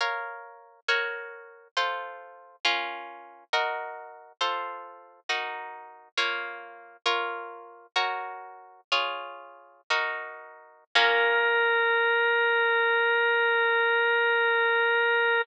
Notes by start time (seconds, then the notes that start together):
0.00 A#4 C#5 F5
0.88 F#4 A#4 C#5
1.77 F4 A4 C5
2.65 C#4 F4 A#4
3.53 F#4 A#4 D#5
4.41 F4 A4 C5
5.29 D#4 F#4 A#4
6.17 A#3 F4 C#5
7.06 F4 A#4 C#5
7.96 F#4 A#4 C#5
8.92 F4 G#4 C#5
9.90 D#4 F#4 A#4
10.95 A#3 C#4 F4 A#4